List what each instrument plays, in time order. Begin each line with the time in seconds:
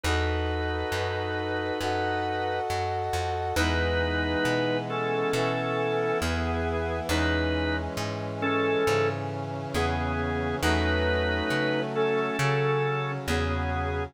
0.03 electric bass (finger) E2, drawbar organ D#4 B4, brass section F#4 A4 B4 D#5
0.92 electric bass (finger) F#2
1.81 electric bass (finger) F#2, brass section F#4 A4 D#5 F#5
2.70 electric bass (finger) F#2
3.13 electric bass (finger) F2
3.56 electric bass (finger) E2, brass section E3 G#3 B3, drawbar organ D#4 B4
4.45 electric bass (finger) B2
4.90 drawbar organ C#4 A4
5.33 electric bass (finger) B2, brass section E3 B3 E4
6.22 electric bass (finger) E2, drawbar organ B3 G#4
7.09 electric bass (finger) E2, brass section E3 G#3 C#4, drawbar organ D#4 B4
7.97 electric bass (finger) G#2
8.42 drawbar organ C#4 A4
8.86 electric bass (finger) G#2, brass section C#3 E3 C#4
9.74 electric bass (finger) E2, drawbar organ B3 G#4
10.62 electric bass (finger) E2, brass section F#3 A3 C#4, drawbar organ D#4 B4
11.50 electric bass (finger) C#3
11.95 drawbar organ C#4 A4
12.39 electric bass (finger) C#3, brass section C#3 F#3 C#4
13.28 electric bass (finger) E2, drawbar organ B3 G#4